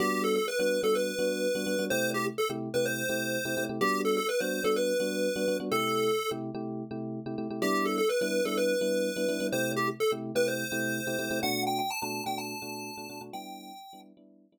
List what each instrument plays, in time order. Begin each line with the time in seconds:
0.00 electric piano 1 G3 B3 D4 F#4, lead 1 (square) G4
0.24 lead 1 (square) A4
0.36 lead 1 (square) A4
0.48 lead 1 (square) B4
0.59 electric piano 1 G3 B3 D4 F#4, lead 1 (square) B4
0.83 electric piano 1 G3 B3 D4 F#4, lead 1 (square) A4
0.95 lead 1 (square) B4
1.19 electric piano 1 G3 B3 D4 F#4
1.55 electric piano 1 G3 B3 D4 F#4
1.66 electric piano 1 G3 B3 D4 F#4
1.79 electric piano 1 G3 B3 D4 F#4
1.90 electric piano 1 C3 A3 E4 G4, lead 1 (square) C5
2.14 lead 1 (square) G4
2.38 lead 1 (square) A4
2.50 electric piano 1 C3 A3 E4 G4
2.74 electric piano 1 C3 A3 E4 G4, lead 1 (square) B4
2.86 lead 1 (square) C5
3.09 electric piano 1 C3 A3 E4 G4
3.45 electric piano 1 C3 A3 E4 G4
3.57 electric piano 1 C3 A3 E4 G4
3.69 electric piano 1 C3 A3 E4 G4
3.81 electric piano 1 G3 B3 D4 F#4, lead 1 (square) G4
4.05 lead 1 (square) A4
4.17 lead 1 (square) A4
4.29 lead 1 (square) B4
4.40 electric piano 1 G3 B3 D4 F#4, lead 1 (square) C5
4.64 electric piano 1 G3 B3 D4 F#4, lead 1 (square) A4
4.76 lead 1 (square) B4
5.00 electric piano 1 G3 B3 D4 F#4
5.36 electric piano 1 G3 B3 D4 F#4
5.48 electric piano 1 G3 B3 D4 F#4
5.60 electric piano 1 G3 B3 D4 F#4
5.72 electric piano 1 C3 A3 E4 G4, lead 1 (square) A4
6.31 electric piano 1 C3 A3 E4 G4
6.55 electric piano 1 C3 A3 E4 G4
6.91 electric piano 1 C3 A3 E4 G4
7.26 electric piano 1 C3 A3 E4 G4
7.38 electric piano 1 C3 A3 E4 G4
7.50 electric piano 1 C3 A3 E4 G4
7.62 electric piano 1 G3 B3 D4 E4, lead 1 (square) G4
7.85 lead 1 (square) A4
7.98 lead 1 (square) A4
8.09 lead 1 (square) B4
8.21 electric piano 1 G3 B3 D4 E4, lead 1 (square) B4
8.45 electric piano 1 G3 B3 D4 E4, lead 1 (square) A4
8.57 lead 1 (square) B4
8.81 electric piano 1 G3 B3 D4 E4
9.16 electric piano 1 G3 B3 D4 E4
9.28 electric piano 1 G3 B3 D4 E4
9.40 electric piano 1 G3 B3 D4 E4
9.52 electric piano 1 C3 A3 E4 G4, lead 1 (square) C5
9.76 lead 1 (square) G4
10.00 lead 1 (square) A4
10.12 electric piano 1 C3 A3 E4 G4
10.35 electric piano 1 C3 A3 E4 G4, lead 1 (square) B4
10.48 lead 1 (square) C5
10.72 electric piano 1 C3 A3 E4 G4
11.07 electric piano 1 C3 A3 E4 G4
11.19 electric piano 1 C3 A3 E4 G4
11.31 electric piano 1 C3 A3 E4 G4
11.43 electric piano 1 B2 A3 D4 F#4, lead 1 (square) F#5
11.67 lead 1 (square) G5
11.79 lead 1 (square) G5
11.90 lead 1 (square) A5
12.02 electric piano 1 B2 A3 D4 F#4, lead 1 (square) A5
12.26 electric piano 1 B2 A3 D4 F#4, lead 1 (square) G5
12.38 lead 1 (square) A5
12.62 electric piano 1 B2 A3 D4 F#4
12.97 electric piano 1 B2 A3 D4 F#4
13.10 electric piano 1 B2 A3 D4 F#4
13.21 electric piano 1 B2 A3 D4 F#4
13.33 electric piano 1 G3 B3 D4 E4, lead 1 (square) G5
13.93 electric piano 1 G3 B3 D4 E4
14.17 electric piano 1 G3 B3 D4 E4
14.52 electric piano 1 G3 B3 D4 E4